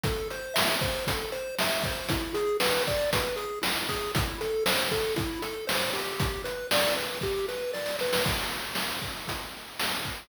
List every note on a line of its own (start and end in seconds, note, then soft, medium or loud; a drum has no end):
0.04 0.28 A4 loud
0.04 kick loud
0.04 closed hi-hat loud
0.30 0.54 C5 medium
0.30 closed hi-hat medium
0.54 0.77 E5 medium
0.54 snare loud
0.81 1.04 C5 medium
0.81 kick loud
0.81 closed hi-hat medium
1.07 1.31 A4 medium
1.07 kick loud
1.07 closed hi-hat loud
1.32 1.55 C5 medium
1.32 closed hi-hat medium
1.59 1.83 E5 medium
1.59 snare loud
1.84 2.08 C5 medium
1.84 kick loud
1.84 closed hi-hat medium
2.09 2.33 E4 medium
2.09 kick loud
2.09 closed hi-hat loud
2.34 2.57 G#4 medium
2.34 closed hi-hat medium
2.60 2.83 B4 medium
2.60 snare loud
2.87 3.10 D5 medium
2.87 kick medium
2.87 closed hi-hat medium
3.13 3.36 B4 medium
3.13 kick loud
3.13 closed hi-hat loud
3.36 3.59 G#4 medium
3.36 closed hi-hat medium
3.62 3.85 E4 medium
3.62 snare loud
3.89 4.12 G#4 medium
3.89 kick medium
3.89 closed hi-hat medium
4.15 4.38 E4 medium
4.15 kick loud
4.15 closed hi-hat loud
4.41 4.64 A4 medium
4.41 closed hi-hat medium
4.66 4.89 C5 medium
4.66 snare loud
4.91 5.15 A4 medium
4.91 kick medium
4.91 closed hi-hat medium
5.16 5.39 E4 medium
5.16 kick loud
5.16 closed hi-hat medium
5.42 5.65 A4 medium
5.42 closed hi-hat medium
5.67 5.90 C5 medium
5.67 snare loud
5.93 6.42 G4 medium
5.93 open hi-hat medium
6.20 kick loud
6.20 closed hi-hat loud
6.44 6.67 B4 medium
6.44 closed hi-hat medium
6.71 6.95 D5 medium
6.71 snare loud
6.96 7.19 B4 medium
6.96 closed hi-hat medium
7.21 7.46 G4 medium
7.21 kick medium
7.21 snare medium
7.49 7.72 B4 medium
7.49 snare medium
7.73 7.96 D5 medium
7.73 snare medium
7.86 snare medium
7.99 8.24 B4 medium
7.99 snare medium
8.13 snare loud
8.25 kick loud
8.25 crash loud
8.75 snare loud
9.02 kick medium
9.28 kick medium
9.28 closed hi-hat loud
9.79 snare loud
10.05 kick medium